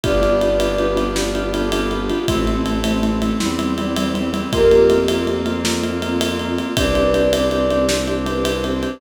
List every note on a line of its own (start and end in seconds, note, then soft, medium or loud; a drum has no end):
0.04 2.10 G1 medium
0.04 2.26 B3 medium
0.04 0.12 B3 loud
0.04 2.26 D4 medium
0.04 0.12 D4 medium
0.04 2.26 F4 medium
0.04 0.12 F4 loud
0.04 2.26 G4 medium
0.04 0.12 G4 loud
0.04 0.75 B4 medium
0.04 0.75 D5 loud
0.04 kick medium
0.04 ride medium
0.21 0.29 B3 medium
0.21 0.29 D4 medium
0.21 0.29 F4 medium
0.21 0.29 G4 medium
0.21 ride medium
0.41 0.49 B3 medium
0.41 0.49 D4 medium
0.41 0.49 F4 medium
0.41 0.49 G4 medium
0.41 ride medium
0.60 0.68 B3 medium
0.60 0.68 D4 medium
0.60 0.68 F4 medium
0.60 0.68 G4 medium
0.60 ride medium
0.79 0.87 B3 medium
0.79 0.87 D4 medium
0.79 0.87 F4 medium
0.79 0.87 G4 medium
0.79 1.12 B4 medium
0.79 ride medium
0.96 1.03 B3 medium
0.96 1.03 D4 medium
0.96 1.03 F4 medium
0.96 1.03 G4 medium
0.96 ride medium
1.15 1.23 B3 medium
1.15 1.23 D4 medium
1.15 1.23 F4 medium
1.15 1.23 G4 medium
1.15 1.51 D5 loud
1.15 snare medium
1.35 1.43 B3 medium
1.35 1.43 D4 medium
1.35 1.43 F4 medium
1.35 1.43 G4 medium
1.35 ride medium
1.53 1.61 B3 medium
1.53 1.61 D4 medium
1.53 1.61 F4 medium
1.53 1.61 G4 medium
1.53 1.87 A4 medium
1.53 ride medium
1.72 1.81 B3 medium
1.72 1.81 D4 medium
1.72 1.81 F4 medium
1.72 1.81 G4 medium
1.72 ride medium
1.91 1.99 B3 medium
1.91 1.99 D4 medium
1.91 2.28 F4 medium
1.91 1.99 F4 medium
1.91 1.99 G4 medium
1.91 ride medium
2.10 2.18 B3 medium
2.10 2.18 D4 medium
2.10 2.18 F4 medium
2.10 2.18 G4 medium
2.10 ride medium
2.28 3.32 A1 medium
2.28 3.39 A3 medium
2.28 2.36 A3 medium
2.28 3.39 C4 medium
2.28 2.36 C4 medium
2.28 3.39 E4 medium
2.28 2.36 E4 medium
2.28 2.44 C5 medium
2.28 kick loud
2.28 ride medium
2.47 2.56 A3 medium
2.47 2.56 C4 medium
2.47 2.56 E4 medium
2.47 ride medium
2.65 2.72 A3 medium
2.65 2.72 C4 medium
2.65 2.72 E4 medium
2.65 ride medium
2.84 2.92 A3 medium
2.84 2.92 C4 medium
2.84 2.92 E4 medium
2.84 3.00 C5 medium
2.84 ride medium
3.02 3.10 A3 medium
3.02 3.10 C4 medium
3.02 3.10 E4 medium
3.02 ride medium
3.22 3.30 A3 medium
3.22 3.30 C4 medium
3.22 3.30 E4 medium
3.22 ride medium
3.40 4.43 E2 medium
3.40 3.47 G3 loud
3.40 4.52 G3 medium
3.40 3.47 C4 medium
3.40 4.51 C4 medium
3.40 3.47 E4 loud
3.40 4.52 E4 medium
3.40 snare medium
3.59 3.66 G3 medium
3.59 3.66 C4 medium
3.59 3.66 E4 medium
3.59 ride medium
3.78 3.86 G3 medium
3.78 3.86 C4 medium
3.78 3.86 E4 medium
3.78 3.96 D5 medium
3.78 ride medium
3.96 4.04 G3 medium
3.96 4.04 C4 medium
3.96 4.04 E4 medium
3.96 4.28 C5 medium
3.96 ride medium
4.14 4.21 G3 medium
4.14 4.21 C4 medium
4.14 4.21 E4 medium
4.14 ride medium
4.33 4.40 G3 medium
4.33 4.40 C4 medium
4.33 4.40 E4 medium
4.33 ride medium
4.52 6.59 F2 medium
4.52 6.74 A#3 medium
4.52 4.60 A#3 loud
4.52 6.74 C4 medium
4.52 4.60 C4 loud
4.52 6.74 F4 medium
4.52 4.60 F4 loud
4.52 5.33 G4 loud
4.52 5.33 A#4 loud
4.52 kick medium
4.52 ride medium
4.71 4.79 A#3 medium
4.71 4.79 C4 medium
4.71 4.79 F4 medium
4.71 ride medium
4.90 4.98 A#3 medium
4.90 4.98 C4 medium
4.90 4.98 F4 medium
4.90 ride medium
5.08 5.18 A#3 medium
5.08 5.18 C4 medium
5.08 5.18 F4 medium
5.08 ride medium
5.27 5.35 A#3 medium
5.27 5.35 C4 medium
5.27 5.35 F4 medium
5.27 ride medium
5.46 5.53 A#3 medium
5.46 5.53 C4 medium
5.46 5.53 F4 medium
5.46 ride medium
5.64 5.72 A#3 loud
5.64 5.72 C4 medium
5.64 5.72 F4 medium
5.64 snare loud
5.82 5.90 A#3 medium
5.82 5.90 C4 medium
5.82 5.90 F4 medium
5.82 ride medium
6.02 6.10 A#3 medium
6.02 6.10 C4 medium
6.02 6.10 F4 medium
6.02 ride medium
6.21 6.29 A#3 medium
6.21 6.29 C4 medium
6.21 6.29 F4 medium
6.21 ride loud
6.39 6.48 A#3 medium
6.39 6.48 C4 medium
6.39 6.48 F4 medium
6.39 ride medium
6.58 6.66 A#3 medium
6.58 6.66 C4 medium
6.58 6.66 F4 medium
6.58 ride medium
6.76 8.84 C2 medium
6.76 8.98 C4 medium
6.76 6.84 C4 medium
6.76 8.98 D4 medium
6.76 6.84 D4 loud
6.76 8.98 G4 medium
6.76 6.84 G4 medium
6.76 7.48 B4 medium
6.76 7.48 D5 loud
6.76 kick loud
6.76 ride loud
6.95 7.03 C4 medium
6.95 7.03 D4 medium
6.95 7.03 G4 medium
6.95 ride medium
7.14 7.21 C4 medium
7.14 7.21 D4 medium
7.14 7.21 G4 medium
7.14 ride medium
7.33 7.41 C4 medium
7.33 7.41 D4 medium
7.33 7.41 G4 medium
7.33 ride loud
7.50 7.57 C4 medium
7.50 7.57 D4 medium
7.50 7.57 G4 medium
7.50 7.83 D5 medium
7.50 ride medium
7.71 7.78 C4 medium
7.71 7.78 D4 medium
7.71 7.78 G4 medium
7.71 ride medium
7.89 7.97 C4 medium
7.89 7.97 D4 medium
7.89 7.97 G4 medium
7.89 8.19 C5 medium
7.89 snare loud
8.08 8.15 C4 medium
8.08 8.15 D4 medium
8.08 8.15 G4 medium
8.08 ride medium
8.26 8.33 C4 medium
8.26 8.33 D4 medium
8.26 8.33 G4 medium
8.26 8.59 B4 medium
8.26 ride medium
8.44 8.51 C4 medium
8.44 8.51 D4 medium
8.44 8.51 G4 medium
8.44 ride medium
8.64 8.72 C4 medium
8.64 8.72 D4 medium
8.64 8.72 G4 medium
8.64 8.98 C5 medium
8.64 ride medium
8.83 8.90 C4 medium
8.83 8.90 D4 medium
8.83 8.90 G4 medium
8.83 ride medium